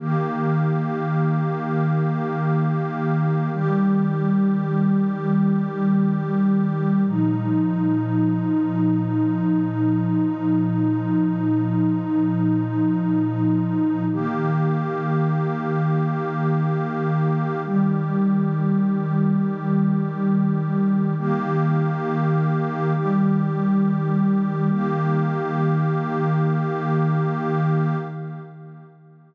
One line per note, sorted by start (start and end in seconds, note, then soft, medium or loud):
0.00 3.49 D#3 medium
0.00 3.49 A#3 loud
0.00 3.49 G4 medium
3.53 7.03 D#3 medium
3.53 7.03 G3 loud
3.53 7.03 G4 medium
7.06 14.04 A#2 medium
7.06 14.04 F3 medium
7.06 14.04 D#4 medium
14.12 17.62 D#3 medium
14.12 17.62 A#3 medium
14.12 17.62 G4 medium
17.65 21.14 D#3 medium
17.65 21.14 G3 medium
17.65 21.14 G4 medium
21.18 22.92 D#3 loud
21.18 22.92 A#3 loud
21.18 22.92 G4 loud
22.94 24.69 D#3 medium
22.94 24.69 G3 medium
22.94 24.69 G4 medium
24.71 27.96 D#3 loud
24.71 27.96 A#3 loud
24.71 27.96 G4 loud